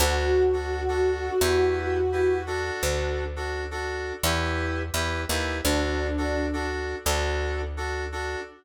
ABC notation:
X:1
M:4/4
L:1/16
Q:1/4=85
K:D
V:1 name="Ocarina"
F16 | z16 | D6 z10 |]
V:2 name="Electric Piano 2"
[DFA]3 [DFA]2 [DFA]3 [EGB]4 [EGB]2 [DFA]2- | [DFA]3 [DFA]2 [DFA]3 [EGB]4 [EGB]2 [EGB]2 | [DFA]3 [DFA]2 [DFA]3 [DFA]4 [DFA]2 [DFA]2 |]
V:3 name="Electric Bass (finger)" clef=bass
D,,8 E,,8 | D,,8 E,,4 E,,2 ^D,,2 | D,,8 D,,8 |]